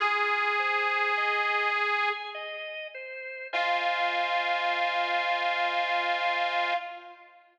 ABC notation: X:1
M:3/4
L:1/8
Q:1/4=51
K:Fm
V:1 name="Harmonica"
A4 z2 | F6 |]
V:2 name="Drawbar Organ"
F c e a e c | [Fcea]6 |]